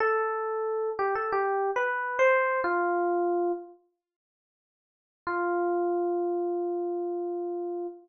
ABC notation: X:1
M:4/4
L:1/16
Q:1/4=91
K:Flyd
V:1 name="Electric Piano 1"
A6 G A (3G4 B4 c4 | F6 z10 | F16 |]